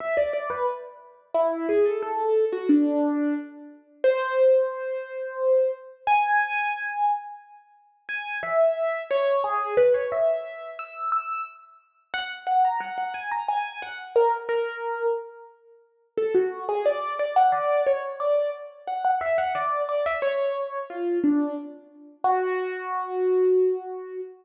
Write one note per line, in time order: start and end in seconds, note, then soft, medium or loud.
0.00 0.16 E5 loud
0.17 0.33 D5 medium
0.33 0.49 D5 medium
0.50 0.66 B4 medium
1.34 1.67 E4 medium
1.69 1.85 G#4 medium
1.85 2.01 A4 medium
2.03 2.45 A4 loud
2.53 2.69 F#4 medium
2.69 3.34 D4 medium
4.04 5.71 C5 loud
6.07 7.05 G#5 loud
8.09 8.38 G#5 loud
8.43 9.03 E5 medium
9.11 9.43 C#5 medium
9.44 9.74 G#4 medium
9.77 9.93 B4 loud
9.94 10.10 C#5 loud
10.12 10.70 E5 medium
10.79 11.10 E6 medium
11.12 11.42 E6 medium
12.14 12.30 F#5 loud
12.47 12.63 F#5 medium
12.65 12.81 A#5 medium
12.80 12.96 F#5 medium
12.98 13.14 F#5 medium
13.14 13.30 G#5 medium
13.31 13.47 A#5 medium
13.48 13.80 G#5 medium
13.82 13.98 F#5 medium
14.16 14.32 A#4 loud
14.49 15.06 A#4 medium
16.18 16.34 A4 loud
16.35 16.64 F#4 medium
16.69 16.85 G#4 medium
16.86 17.13 D5 medium
17.19 17.35 D5 medium
17.36 17.52 F#5 medium
17.52 17.81 D5 medium
17.87 18.19 C#5 medium
18.20 18.50 D5 loud
18.87 19.04 F#5 medium
19.05 19.21 F#5 medium
19.21 19.37 E5 medium
19.38 19.54 F#5 medium
19.55 19.82 D5 medium
19.89 20.05 D5 medium
20.06 20.22 E5 medium
20.22 20.78 C#5 medium
20.90 21.19 F4 medium
21.24 21.54 D4 medium
22.24 24.21 F#4 loud